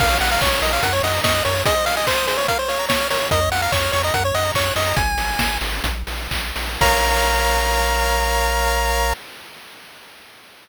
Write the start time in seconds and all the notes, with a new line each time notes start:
0.00 A#1 A#4 F5, kick, crash
0.10 C#5
0.21 A#1 F5 F#5, open hi-hat
0.31 F5 A#5
0.41 A#1 C#5 C#6, kick, clap
0.52 F6
0.62 A#1 A#4 D#5, open hi-hat
0.73 C#5 F5
0.83 F#2 A#4 F#5, kick, closed hi-hat
0.93 C#5
1.03 F#2 D#5 F#5, open hi-hat
1.14 A#5
1.24 F#2 D#5 C#6, kick, snare
1.34 F#6
1.45 F#2 A#4 C#5, open hi-hat
1.55 C#5
1.66 G#4 D#5, kick, closed hi-hat
1.76 C5
1.86 D#5 F5, open hi-hat
1.96 D#5 G#5
2.07 C5 C6, kick, clap
2.17 D#6
2.27 G#4 C5, open hi-hat
2.37 C5 C#5
2.48 A#4 F5, kick, closed hi-hat
2.59 C5 C#5
2.68 C#5 F5, open hi-hat
2.79 A#5
2.89 C#5 C#6, kick, snare
3.00 F6
3.10 A#4 C#5, open hi-hat
3.21 C#5
3.31 F2 A#4 D#5, kick, closed hi-hat
3.41 C#5
3.51 F2 F5 F#5, open hi-hat
3.62 F5 A#5
3.72 F2 C#5 C#6, kick, clap
3.83 F6
3.92 F2 C#5 C#6, open hi-hat
4.03 D#5 A#5
4.14 F#2 A#4 F#5, kick, closed hi-hat
4.24 C#5
4.34 F#2 D#5 F#5, open hi-hat
4.45 A#5
4.54 F#2 C#5 C#6, kick, clap
4.66 F#6
4.76 F#2 D#5 C#6, open hi-hat
4.86 A#5
4.96 G#1 G#5, kick, closed hi-hat
5.17 G#1, open hi-hat
5.39 G#1, kick, snare
5.61 G#1, open hi-hat
5.84 A#1, kick, closed hi-hat
6.07 A#1, open hi-hat
6.31 A#1, kick, clap
6.56 A#1, open hi-hat
6.81 A#1 A#4 C#5 F5 A#5, kick, crash